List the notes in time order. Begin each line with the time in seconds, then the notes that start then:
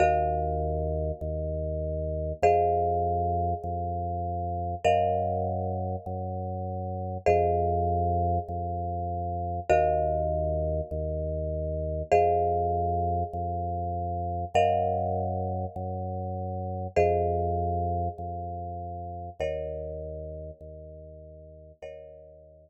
0.00 D#2 F#4 A#4 D#5 F5
1.21 D#2
2.42 F2 G#4 C5 D#5 F5
3.64 F2
4.84 F#2 A#4 D#5 F5 F#5
6.06 F#2
7.26 F2 G#4 C5 D#5 F5
8.48 F2
9.70 D#2 F#4 A#4 D#5 F5
10.91 D#2
12.12 F2 G#4 C5 D#5 F5
13.33 F2
14.54 F#2 A#4 D#5 F5 F#5
15.76 F#2
16.96 F2 G#4 C5 D#5 F5
18.18 F2
19.40 D#2 A#4 C#5 D#5 F#5
20.61 D#2
21.82 D#2 A#4 C#5 D#5 F#5